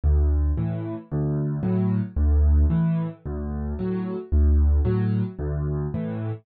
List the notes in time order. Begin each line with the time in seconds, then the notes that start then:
0.04 D2
0.57 A2 E3
1.11 D2
1.63 A2 F#3
2.16 D2
2.70 A2 E3
3.26 D2
3.79 A2 F#3
4.32 D2
4.85 A2 F#3
5.39 D2
5.94 A2 E3